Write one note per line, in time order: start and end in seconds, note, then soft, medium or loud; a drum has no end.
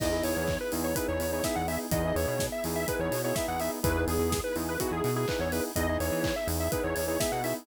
0.00 0.23 E2 loud
0.00 1.90 B3 medium
0.00 0.10 B3 medium
0.00 1.90 D#4 medium
0.00 0.10 D#4 medium
0.00 1.90 E4 medium
0.00 0.10 E4 medium
0.00 1.90 G#4 medium
0.00 0.10 G#4 medium
0.00 0.23 D#5 loud
0.00 kick medium
0.00 crash medium
0.12 0.51 B3 medium
0.12 0.51 D#4 medium
0.12 0.51 E4 medium
0.12 0.51 G#4 medium
0.24 0.35 E2 medium
0.24 0.58 C#5 loud
0.24 open hi-hat medium
0.37 0.58 E2 loud
0.47 kick medium
0.47 clap medium
0.60 0.72 B4 medium
0.72 0.94 E2 loud
0.72 0.91 B3 medium
0.72 0.91 D#4 medium
0.72 0.91 E4 medium
0.72 0.91 G#4 medium
0.72 open hi-hat medium
0.84 0.96 C#5 medium
0.95 1.25 B3 medium
0.95 1.25 D#4 medium
0.95 1.25 E4 medium
0.95 1.25 G#4 medium
0.95 1.07 B4 medium
0.95 kick medium
0.95 closed hi-hat medium
1.08 1.19 E2 medium
1.08 1.31 C#5 loud
1.20 1.42 E2 medium
1.20 open hi-hat medium
1.32 1.42 B3 medium
1.32 1.42 D#4 medium
1.32 1.42 E4 medium
1.32 1.42 G#4 medium
1.32 1.44 C#5 medium
1.44 1.63 B3 medium
1.44 1.63 D#4 medium
1.44 1.63 E4 medium
1.44 1.63 G#4 medium
1.44 1.55 E5 loud
1.44 kick medium
1.44 snare medium
1.55 1.78 E2 loud
1.55 1.67 F#5 loud
1.67 1.87 B3 medium
1.67 1.87 D#4 medium
1.67 1.87 E4 medium
1.67 1.87 G#4 medium
1.67 1.79 E5 medium
1.67 open hi-hat medium
1.91 2.13 E2 loud
1.91 2.02 B3 medium
1.91 3.83 B3 medium
1.91 2.02 D#4 medium
1.91 3.83 D#4 medium
1.91 2.02 E4 medium
1.91 3.83 E4 medium
1.91 2.02 G#4 medium
1.91 3.83 G#4 medium
1.91 2.15 D#5 loud
1.91 kick medium
1.91 closed hi-hat medium
2.04 2.43 B3 medium
2.04 2.43 D#4 medium
2.04 2.43 E4 medium
2.04 2.43 G#4 medium
2.16 2.26 E2 loud
2.16 2.46 C#5 loud
2.16 open hi-hat medium
2.28 2.49 B2 medium
2.39 kick medium
2.39 snare medium
2.52 2.64 E5 loud
2.64 2.86 E2 loud
2.64 2.84 B3 medium
2.64 2.84 D#4 medium
2.64 2.84 E4 medium
2.64 2.84 G#4 medium
2.64 open hi-hat medium
2.76 2.87 E5 loud
2.87 3.16 B3 medium
2.87 3.16 D#4 medium
2.87 3.16 E4 medium
2.87 3.16 G#4 medium
2.87 3.00 B4 loud
2.87 kick medium
2.87 closed hi-hat medium
2.99 3.10 E2 loud
2.99 3.21 C#5 loud
3.11 3.33 B2 medium
3.11 open hi-hat medium
3.24 3.34 B3 medium
3.24 3.34 D#4 medium
3.24 3.34 E4 medium
3.24 3.34 G#4 medium
3.24 3.36 C#5 loud
3.35 3.56 B3 medium
3.35 3.56 D#4 medium
3.35 3.56 E4 medium
3.35 3.56 G#4 medium
3.35 3.47 E5 loud
3.35 kick medium
3.35 snare medium
3.48 3.70 E2 loud
3.48 3.60 F#5 loud
3.60 3.79 B3 medium
3.60 3.79 D#4 medium
3.60 3.79 E4 medium
3.60 3.79 G#4 medium
3.60 3.71 E5 medium
3.60 open hi-hat medium
3.83 4.05 E2 loud
3.83 3.93 B3 medium
3.83 5.74 B3 medium
3.83 3.93 D#4 medium
3.83 5.74 D#4 medium
3.83 3.93 E4 loud
3.83 5.74 E4 medium
3.83 3.93 G#4 loud
3.83 5.74 G#4 medium
3.83 4.04 B4 loud
3.83 kick loud
3.83 closed hi-hat medium
3.95 4.34 B3 medium
3.95 4.34 D#4 medium
3.95 4.34 E4 medium
3.95 4.34 G#4 medium
4.08 4.18 E2 loud
4.08 4.41 G#4 loud
4.08 open hi-hat medium
4.19 4.41 E2 loud
4.32 kick medium
4.32 snare medium
4.44 4.55 B4 loud
4.56 4.78 E2 loud
4.56 4.75 B3 medium
4.56 4.75 D#4 medium
4.56 4.75 E4 medium
4.56 4.75 G#4 medium
4.56 open hi-hat medium
4.69 4.80 B4 medium
4.80 5.09 B3 medium
4.80 5.09 D#4 medium
4.80 5.09 E4 medium
4.80 4.91 F#4 loud
4.80 5.09 G#4 medium
4.80 kick medium
4.80 closed hi-hat medium
4.91 5.02 E2 loud
4.91 5.14 G#4 loud
5.04 5.26 B2 loud
5.04 open hi-hat medium
5.16 5.25 B3 medium
5.16 5.25 D#4 medium
5.16 5.25 E4 medium
5.16 5.25 G#4 medium
5.16 5.28 G#4 loud
5.28 5.48 B3 medium
5.28 5.48 D#4 medium
5.28 5.48 E4 medium
5.28 5.48 G#4 medium
5.28 5.40 B4 loud
5.28 kick medium
5.28 clap loud
5.39 5.61 E2 loud
5.39 5.52 C#5 loud
5.52 5.71 B3 medium
5.52 5.71 D#4 medium
5.52 5.71 E4 medium
5.52 5.71 G#4 medium
5.52 5.64 B4 loud
5.52 open hi-hat medium
5.75 5.98 E2 loud
5.75 7.65 B3 medium
5.75 5.86 B3 medium
5.75 7.65 D#4 medium
5.75 5.86 D#4 medium
5.75 7.65 E4 medium
5.75 5.86 E4 medium
5.75 7.65 G#4 medium
5.75 5.86 G#4 medium
5.75 5.98 D#5 loud
5.75 kick medium
5.75 closed hi-hat medium
5.89 6.27 B3 medium
5.89 6.27 D#4 medium
5.89 6.27 E4 medium
5.89 6.27 G#4 medium
6.00 6.11 E2 medium
6.00 6.35 C#5 loud
6.00 open hi-hat medium
6.12 6.33 E3 medium
6.24 kick medium
6.24 clap loud
6.36 6.47 E5 loud
6.47 6.69 E2 loud
6.47 6.67 B3 medium
6.47 6.67 D#4 medium
6.47 6.67 E4 medium
6.47 6.67 G#4 medium
6.47 open hi-hat medium
6.60 6.71 E5 medium
6.72 7.01 B3 medium
6.72 7.01 D#4 medium
6.72 7.01 E4 medium
6.72 7.01 G#4 medium
6.72 6.83 B4 loud
6.72 kick medium
6.72 closed hi-hat medium
6.84 6.95 E2 loud
6.84 7.07 C#5 medium
6.96 7.18 E2 loud
6.96 open hi-hat medium
7.08 7.17 B3 medium
7.08 7.17 D#4 medium
7.08 7.17 E4 medium
7.08 7.17 G#4 medium
7.08 7.19 C#5 loud
7.20 7.39 B3 medium
7.20 7.39 D#4 medium
7.20 7.39 E4 medium
7.20 7.39 G#4 medium
7.20 7.31 E5 loud
7.20 kick medium
7.20 snare loud
7.32 7.54 B2 medium
7.32 7.43 F#5 medium
7.44 7.63 B3 medium
7.44 7.63 D#4 medium
7.44 7.63 E4 medium
7.44 7.63 G#4 medium
7.44 7.55 E5 medium
7.44 open hi-hat medium